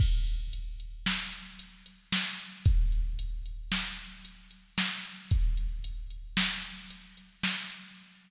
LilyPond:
\new DrumStaff \drummode { \time 5/4 \tempo 4 = 113 <cymc bd>8 hh8 hh8 hh8 sn8 hh8 hh8 hh8 sn8 hh8 | <hh bd>8 hh8 hh8 hh8 sn8 hh8 hh8 hh8 sn8 hh8 | <hh bd>8 hh8 hh8 hh8 sn8 hh8 hh8 hh8 sn8 hh8 | }